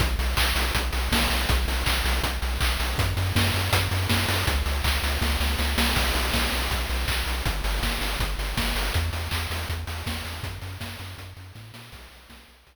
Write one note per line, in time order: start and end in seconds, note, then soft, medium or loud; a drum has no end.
0.00 0.16 B1 medium
0.00 kick loud
0.00 closed hi-hat loud
0.19 0.35 B1 medium
0.19 open hi-hat medium
0.37 0.53 B1 medium
0.37 kick medium
0.37 clap loud
0.56 0.72 B1 medium
0.56 open hi-hat medium
0.75 0.91 B1 medium
0.75 kick medium
0.75 closed hi-hat loud
0.93 1.09 B1 medium
0.93 open hi-hat medium
1.12 1.27 B1 medium
1.12 kick medium
1.12 snare loud
1.30 1.46 B1 medium
1.30 open hi-hat medium
1.49 1.65 B1 medium
1.49 kick loud
1.49 closed hi-hat loud
1.68 1.84 B1 medium
1.68 open hi-hat medium
1.86 2.02 B1 medium
1.86 kick medium
1.86 clap loud
2.05 2.20 B1 medium
2.05 open hi-hat medium
2.23 2.39 B1 medium
2.23 kick medium
2.23 closed hi-hat loud
2.42 2.58 B1 medium
2.42 open hi-hat medium
2.60 2.77 B1 medium
2.60 kick medium
2.60 clap loud
2.80 2.96 B1 medium
2.80 open hi-hat medium
2.98 3.14 F#2 medium
2.98 kick loud
2.98 closed hi-hat loud
3.17 3.33 F#2 medium
3.17 open hi-hat medium
3.35 3.51 F#2 medium
3.35 kick medium
3.35 snare loud
3.54 3.70 F#2 medium
3.54 open hi-hat medium
3.73 3.88 F#2 medium
3.73 kick medium
3.73 closed hi-hat loud
3.91 4.07 F#2 medium
3.91 open hi-hat medium
4.09 4.26 F#2 medium
4.09 kick medium
4.09 snare loud
4.29 4.44 F#2 medium
4.29 open hi-hat medium
4.47 4.63 C#2 medium
4.47 kick loud
4.47 closed hi-hat loud
4.66 4.82 C#2 medium
4.66 open hi-hat medium
4.84 5.00 C#2 medium
4.84 kick medium
4.84 clap loud
5.03 5.18 C#2 medium
5.03 open hi-hat medium
5.21 5.37 C#2 medium
5.21 kick medium
5.21 snare medium
5.40 5.56 C#2 medium
5.40 snare medium
5.59 5.76 C#2 medium
5.59 snare medium
5.78 5.94 C2 medium
5.78 snare loud
5.96 6.12 B1 medium
5.96 kick medium
5.96 crash loud
6.15 6.31 B1 medium
6.15 open hi-hat medium
6.33 6.49 B1 medium
6.33 kick medium
6.33 snare loud
6.52 6.68 B1 medium
6.52 open hi-hat medium
6.71 6.87 B1 medium
6.71 kick medium
6.71 closed hi-hat medium
6.89 7.05 B1 medium
6.89 open hi-hat medium
7.08 7.24 B1 medium
7.08 kick medium
7.08 clap loud
7.26 7.42 B1 medium
7.26 open hi-hat medium
7.45 7.61 G1 medium
7.45 kick medium
7.45 closed hi-hat medium
7.64 7.80 G1 medium
7.64 open hi-hat medium
7.82 7.98 G1 medium
7.82 kick medium
7.82 snare medium
8.01 8.17 G1 medium
8.01 open hi-hat medium
8.20 8.35 G1 medium
8.20 kick medium
8.20 closed hi-hat medium
8.38 8.54 G1 medium
8.38 open hi-hat medium
8.57 8.73 G1 medium
8.57 kick medium
8.57 snare loud
8.75 8.91 G1 medium
8.75 open hi-hat medium
8.94 9.11 E2 medium
8.94 kick medium
8.94 closed hi-hat medium
9.13 9.29 E2 medium
9.13 open hi-hat medium
9.31 9.47 E2 medium
9.31 kick medium
9.31 clap loud
9.50 9.66 E2 medium
9.50 open hi-hat medium
9.69 9.85 E2 medium
9.69 kick medium
9.69 closed hi-hat medium
9.87 10.03 E2 medium
9.87 open hi-hat medium
10.06 10.22 E2 medium
10.06 kick medium
10.06 snare loud
10.25 10.41 E2 medium
10.25 open hi-hat medium
10.43 10.59 F#2 medium
10.43 kick loud
10.43 closed hi-hat medium
10.62 10.78 F#2 medium
10.62 open hi-hat medium
10.80 10.97 F#2 medium
10.80 kick medium
10.80 snare loud
10.99 11.15 F#2 medium
10.99 open hi-hat medium
11.18 11.34 F#2 medium
11.18 kick medium
11.18 closed hi-hat medium
11.37 11.52 F#2 medium
11.37 open hi-hat medium
11.55 11.72 A2 medium
11.55 kick medium
11.55 snare medium
11.74 11.91 A#2 medium
11.74 snare loud
11.92 12.08 B1 medium
11.92 kick medium
11.92 crash loud
12.11 12.27 B1 medium
12.11 open hi-hat medium
12.30 12.45 B1 medium
12.30 kick medium
12.30 snare loud
12.48 12.64 B1 medium
12.48 open hi-hat medium
12.67 12.76 B1 medium
12.67 kick medium
12.67 closed hi-hat loud